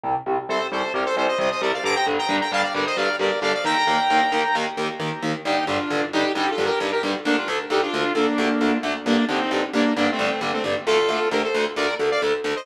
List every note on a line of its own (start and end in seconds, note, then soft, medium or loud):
0.03 0.13 C2 medium
0.03 0.13 C3 medium
0.03 0.13 G3 medium
0.26 0.35 C2 medium
0.26 0.35 C3 medium
0.26 0.35 G3 medium
0.49 0.58 C2 medium
0.49 0.58 C3 medium
0.49 0.58 G3 medium
0.49 0.67 A4 medium
0.49 0.67 C5 medium
0.71 0.81 C2 medium
0.71 0.81 C3 medium
0.71 0.81 G3 medium
0.71 0.93 A4 medium
0.71 0.93 C5 medium
0.94 1.03 C2 medium
0.94 1.03 C3 medium
0.94 1.03 G3 medium
0.94 1.04 G4 medium
0.94 1.04 A#4 medium
1.05 1.16 A4 medium
1.05 1.16 C5 medium
1.16 1.26 C2 medium
1.16 1.26 C3 medium
1.16 1.26 G3 medium
1.16 1.27 A4 medium
1.16 1.27 C5 medium
1.28 1.38 C5 medium
1.28 1.38 D#5 medium
1.39 1.48 C2 medium
1.39 1.48 C3 medium
1.39 1.48 G3 medium
1.39 1.50 C5 medium
1.39 1.50 D#5 medium
1.51 1.61 C5 medium
1.51 1.61 D#5 medium
1.61 1.70 C2 medium
1.61 1.70 C3 medium
1.61 1.70 G3 medium
1.61 1.72 A#4 medium
1.61 1.72 D5 medium
1.73 1.84 D5 medium
1.73 1.84 F5 medium
1.84 1.93 G2 medium
1.84 1.93 D3 medium
1.84 1.93 G3 medium
1.84 1.95 A#5 medium
1.84 1.95 D6 loud
1.95 2.06 G5 medium
1.95 2.06 A#5 medium
2.06 2.16 G2 medium
2.06 2.16 D3 medium
2.06 2.16 G3 medium
2.18 2.36 G5 medium
2.18 2.36 A#5 medium
2.29 2.38 G2 medium
2.29 2.38 D3 medium
2.29 2.38 G3 medium
2.40 2.51 G5 medium
2.40 2.51 A#5 medium
2.52 2.61 G2 medium
2.52 2.61 D3 medium
2.52 2.61 G3 medium
2.52 2.62 F5 medium
2.52 2.63 A5 medium
2.63 2.73 D5 medium
2.63 2.73 F5 medium
2.74 2.83 G2 medium
2.74 2.83 D3 medium
2.74 2.83 G3 medium
2.74 2.85 A#4 medium
2.74 2.85 D5 medium
2.86 2.97 C5 medium
2.86 2.97 D#5 medium
2.97 3.06 G2 medium
2.97 3.06 D3 medium
2.97 3.06 G3 medium
2.97 3.16 D5 medium
2.97 3.16 F5 medium
3.19 3.28 G2 medium
3.19 3.28 D3 medium
3.19 3.28 G3 medium
3.19 3.40 A#4 medium
3.19 3.40 D5 medium
3.42 3.51 G2 medium
3.42 3.51 D3 medium
3.42 3.51 G3 medium
3.42 3.53 D5 medium
3.42 3.53 F5 medium
3.54 3.64 D5 medium
3.54 3.64 F5 medium
3.65 3.74 D#2 medium
3.65 3.74 D#3 medium
3.65 3.74 A#3 medium
3.65 4.56 G5 medium
3.65 4.56 A#5 medium
3.87 3.96 D#2 medium
3.87 3.96 D#3 medium
3.87 3.96 A#3 medium
4.10 4.19 D#2 medium
4.10 4.19 D#3 medium
4.10 4.19 A#3 medium
4.32 4.41 D#2 medium
4.32 4.41 D#3 medium
4.32 4.41 A#3 medium
4.55 4.64 D#2 medium
4.55 4.64 D#3 medium
4.55 4.64 A#3 medium
4.77 4.86 D#2 medium
4.77 4.86 D#3 medium
4.77 4.86 A#3 medium
5.00 5.09 D#2 medium
5.00 5.09 D#3 medium
5.00 5.09 A#3 medium
5.23 5.32 D#2 medium
5.23 5.32 D#3 medium
5.23 5.32 A#3 medium
5.45 5.54 G2 medium
5.45 5.54 D3 medium
5.45 5.54 G3 medium
5.45 5.65 D#4 medium
5.45 5.65 G4 medium
5.67 5.76 G2 medium
5.67 5.76 D3 medium
5.67 5.76 G3 medium
5.67 6.05 D4 medium
5.67 6.05 F4 medium
5.91 6.00 G2 medium
5.91 6.00 D3 medium
5.91 6.00 G3 medium
6.13 6.22 G2 medium
6.13 6.22 D3 medium
6.13 6.22 G3 medium
6.13 6.32 D#4 medium
6.13 6.32 G4 medium
6.35 6.44 G2 medium
6.35 6.44 D3 medium
6.35 6.44 G3 medium
6.35 6.50 D#4 medium
6.35 6.50 G4 medium
6.50 6.65 F4 medium
6.50 6.65 A4 medium
6.58 6.67 G2 medium
6.58 6.67 D3 medium
6.58 6.67 G3 medium
6.65 6.79 G4 medium
6.65 6.79 A#4 medium
6.80 6.89 G2 medium
6.80 6.89 D3 medium
6.80 6.89 G3 medium
6.92 7.02 G4 medium
6.92 7.02 A#4 medium
7.03 7.12 G2 medium
7.03 7.12 D3 medium
7.03 7.12 G3 medium
7.25 7.34 D2 medium
7.25 7.34 D3 medium
7.25 7.34 A3 medium
7.25 7.36 A#3 medium
7.25 7.36 D4 loud
7.37 7.48 D4 medium
7.37 7.48 F4 medium
7.48 7.57 D2 medium
7.48 7.57 D3 medium
7.48 7.57 A3 medium
7.70 7.79 D2 medium
7.70 7.79 D3 medium
7.70 7.79 A3 medium
7.70 7.81 D#4 medium
7.70 7.81 G4 medium
7.82 8.13 D4 medium
7.82 8.13 F4 medium
7.94 8.03 D2 medium
7.94 8.03 D3 medium
7.94 8.03 A3 medium
8.15 8.24 D2 medium
8.15 8.24 D3 medium
8.15 8.24 A3 medium
8.15 8.78 A#3 medium
8.15 8.78 D4 medium
8.38 8.47 D2 medium
8.38 8.47 D3 medium
8.38 8.47 A3 medium
8.61 8.70 D2 medium
8.61 8.70 D3 medium
8.61 8.70 A3 medium
8.83 8.92 D2 medium
8.83 8.92 D3 medium
8.83 8.92 A3 medium
9.06 9.15 G2 medium
9.06 9.15 D3 medium
9.06 9.15 G3 medium
9.06 9.25 A#3 medium
9.06 9.25 D4 loud
9.29 9.38 G2 medium
9.29 9.38 D3 medium
9.29 9.38 G3 medium
9.29 9.65 C4 medium
9.29 9.65 D#4 medium
9.51 9.60 G2 medium
9.51 9.60 D3 medium
9.51 9.60 G3 medium
9.73 9.83 G2 medium
9.73 9.83 D3 medium
9.73 9.83 G3 medium
9.73 9.94 A#3 medium
9.73 9.94 D4 medium
9.96 10.06 G2 medium
9.96 10.06 D3 medium
9.96 10.06 G3 medium
9.96 10.11 A#3 medium
9.96 10.11 D4 medium
10.11 10.25 A3 medium
10.11 10.25 C4 medium
10.19 10.28 G2 medium
10.19 10.28 D3 medium
10.19 10.28 G3 medium
10.26 10.40 A3 medium
10.26 10.40 C4 medium
10.41 10.50 G2 medium
10.41 10.50 D3 medium
10.41 10.50 G3 medium
10.53 10.63 A3 medium
10.53 10.63 C4 medium
10.64 10.73 G2 medium
10.64 10.73 D3 medium
10.64 10.73 G3 medium
10.86 10.96 D2 medium
10.86 10.96 D3 medium
10.86 10.96 A3 medium
10.86 11.29 F4 medium
10.86 11.29 A4 loud
11.09 11.18 D2 medium
11.09 11.18 D3 medium
11.09 11.18 A3 medium
11.31 11.40 D2 medium
11.31 11.40 D3 medium
11.31 11.40 A3 medium
11.31 11.42 G4 medium
11.31 11.42 A#4 medium
11.43 11.65 A4 medium
11.43 11.65 C5 medium
11.54 11.63 D2 medium
11.54 11.63 D3 medium
11.54 11.63 A3 medium
11.76 11.85 D2 medium
11.76 11.85 D3 medium
11.76 11.85 A3 medium
11.76 11.95 A#4 medium
11.76 11.95 D5 medium
11.99 12.08 D2 medium
11.99 12.08 D3 medium
11.99 12.08 A3 medium
12.11 12.21 D5 medium
12.11 12.21 F5 medium
12.22 12.31 D2 medium
12.22 12.31 D3 medium
12.22 12.31 A3 medium
12.44 12.53 D2 medium
12.44 12.53 D3 medium
12.44 12.53 A3 medium
12.56 12.66 C5 medium
12.56 12.66 D#5 loud